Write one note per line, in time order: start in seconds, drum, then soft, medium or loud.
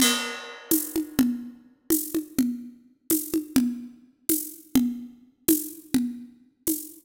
0.00 crash loud
0.00 low conga medium
0.71 tambourine medium
0.71 high conga medium
0.96 high conga medium
1.19 low conga loud
1.90 tambourine medium
1.90 high conga medium
2.15 high conga medium
2.38 low conga medium
3.10 tambourine medium
3.10 high conga medium
3.34 high conga medium
3.56 low conga loud
4.29 tambourine medium
4.29 high conga medium
4.75 low conga loud
5.48 tambourine medium
5.48 high conga medium
5.94 low conga medium
6.67 tambourine medium
6.67 high conga medium